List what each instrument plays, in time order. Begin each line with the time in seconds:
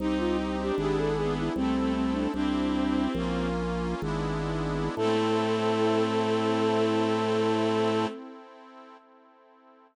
0.00 drawbar organ C2, accordion C4 D#4 G4, pad 2 (warm) C4 D#4 G4, flute D#4, violin D#4
0.19 flute F4
0.59 violin D4, flute G4
0.77 drawbar organ G#1, accordion B3 D4 E4 G#4, pad 2 (warm) B3 D4 E4 G#4, flute G4
0.98 flute A4
1.15 violin B3, flute G#4
1.38 flute E4
1.56 drawbar organ C2, violin A3, flute C4, pad 2 (warm) C4 E4 A4, accordion C4 E4 A4
1.76 violin A3
1.95 flute C4
2.13 flute D4
2.34 drawbar organ C2, violin C4, accordion C4 E4 G4, pad 2 (warm) C4 E4 G4, flute D4
3.15 drawbar organ A#1, pad 2 (warm) A#3 C#4 F4, accordion A#3 C#4 F4
4.02 drawbar organ G#1, accordion G#3 B3 D4 E4, pad 2 (warm) G#3 B3 D4 E4
4.96 drawbar organ A2, violin A3, pad 2 (warm) C4 E4 A4, accordion C4 E4 A4, flute A4